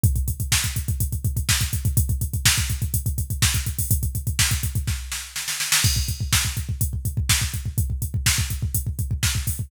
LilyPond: \new DrumStaff \drummode { \time 4/4 \tempo 4 = 124 <hh bd>16 <hh bd>16 <hh bd>16 <hh bd>16 <bd sn>16 <hh bd>16 <hh bd>16 <hh bd>16 <hh bd>16 <hh bd>16 <hh bd>16 <hh bd>16 <bd sn>16 <hh bd>16 <hh bd>16 <hh bd>16 | <hh bd>16 <hh bd>16 <hh bd>16 <hh bd>16 <bd sn>16 <hh bd>16 <hh bd>16 <hh bd>16 <hh bd>16 <hh bd>16 <hh bd>16 <hh bd>16 <bd sn>16 <hh bd>16 <hh bd>16 <hho bd>16 | <hh bd>16 <hh bd>16 <hh bd>16 <hh bd>16 <bd sn>16 <hh bd>16 <hh bd>16 <hh bd>16 <bd sn>8 sn8 sn16 sn16 sn16 sn16 | <cymc bd>16 bd16 <hh bd>16 bd16 <bd sn>16 bd16 <hh bd>16 bd16 <hh bd>16 bd16 <hh bd>16 bd16 <bd sn>16 bd16 <hh bd>16 bd16 |
<hh bd>16 bd16 <hh bd>16 bd16 <bd sn>16 bd16 <hh bd>16 bd16 <hh bd>16 bd16 <hh bd>16 bd16 <bd sn>16 bd16 <hho bd>16 bd16 | }